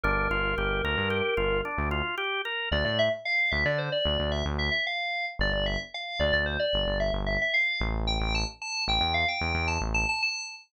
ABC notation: X:1
M:5/4
L:1/16
Q:1/4=112
K:F
V:1 name="Electric Piano 2"
B12 z8 | [K:Dm] d d e z f2 e d c d3 e z e e f3 z | d d e z f2 d d c d3 e z e e f3 z | g g a z a2 g g f g3 a z a a a3 z |]
V:2 name="Drawbar Organ"
D2 F2 G2 B2 G2 F2 D2 F2 G2 B2 | [K:Dm] z20 | z20 | z20 |]
V:3 name="Synth Bass 1" clef=bass
G,,,2 G,,,2 G,,,2 D,, G,,3 G,,,3 D,,7 | [K:Dm] D,, A,,5 D,, D,3 D,, D,,2 D,,7 | G,,, G,,,5 D,, D,,3 G,,, G,,,2 G,,,5 A,,,2- | A,,, A,,,5 A,,, E,,3 E,, E,,2 A,,,7 |]